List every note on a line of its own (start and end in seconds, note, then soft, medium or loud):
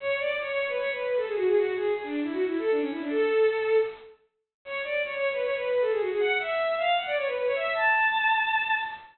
0.00 0.16 C#5 loud
0.19 0.36 D5 loud
0.39 0.48 C#5 loud
0.48 0.67 C#5 loud
0.68 0.77 B4 loud
0.78 0.90 C#5 loud
0.90 1.03 B4 loud
1.03 1.16 B4 medium
1.16 1.26 A4 loud
1.26 1.35 G#4 medium
1.35 1.44 F#4 loud
1.45 1.54 G#4 loud
1.55 1.74 F#4 loud
1.74 1.91 G#4 loud
1.94 2.03 G#4 loud
2.03 2.20 D4 loud
2.23 2.32 E4 loud
2.32 2.44 F#4 loud
2.45 2.58 E4 loud
2.58 2.70 A4 loud
2.71 2.80 D4 loud
2.80 2.89 C#4 loud
2.90 3.00 E4 loud
3.00 3.09 D4 loud
3.10 3.77 A4 loud
4.65 4.81 C#5 loud
4.84 5.01 D5 loud
5.03 5.12 C#5 loud
5.13 5.29 C#5 loud
5.32 5.41 B4 loud
5.42 5.54 C#5 loud
5.55 5.67 B4 loud
5.67 5.80 B4 medium
5.81 5.90 A4 loud
5.90 5.99 G#4 loud
6.00 6.09 F#4 loud
6.10 6.19 G#4 loud
6.19 6.37 F#5 loud
6.39 6.76 E5 loud
6.77 6.95 F5 loud
6.97 7.06 F#5 medium
7.06 7.15 D5 loud
7.16 7.25 C#5 loud
7.26 7.35 B4 loud
7.35 7.44 B4 loud
7.45 7.55 C#5 loud
7.55 7.71 E5 loud
7.74 8.78 A5 loud